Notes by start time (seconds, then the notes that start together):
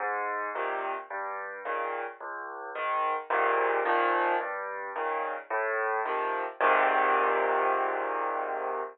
0.00 G#2
0.55 A#2 C3 D#3
1.10 G2
1.65 A#2 C#3 D#3
2.20 C#2
2.75 G#2 D#3
3.30 G#2 A#2 C3 D#3
3.85 A#2 D#3 F3
4.40 G2
4.96 A#2 C#3 D#3
5.50 A2
6.06 C3 D#3 F3
6.61 G#2 A#2 C3 D#3